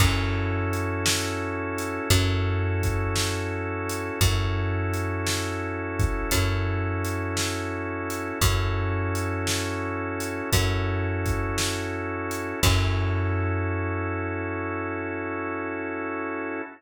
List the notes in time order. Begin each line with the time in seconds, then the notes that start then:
0.00 F#2 C#4 E4 F#4 A4, kick, crash
0.73 closed hi-hat
1.06 snare
1.78 closed hi-hat
2.10 F#2 C#4 E4 F#4 A4, kick, closed hi-hat
2.83 kick, closed hi-hat
3.16 snare
3.89 closed hi-hat
4.21 F#2 C#4 E4 F#4 A4, kick, closed hi-hat
4.94 closed hi-hat
5.27 snare
5.99 kick, closed hi-hat
6.31 F#2 C#4 E4 F#4 A4, kick, closed hi-hat
7.05 closed hi-hat
7.37 snare
8.10 closed hi-hat
8.41 F#2 C#4 E4 F#4 A4, kick, closed hi-hat
9.15 closed hi-hat
9.47 snare
10.20 closed hi-hat
10.52 F#2 C#4 E4 F#4 A4, kick, closed hi-hat
11.26 kick, closed hi-hat
11.58 snare
12.31 closed hi-hat
12.63 F#2 C#4 E4 F#4 A4, kick, crash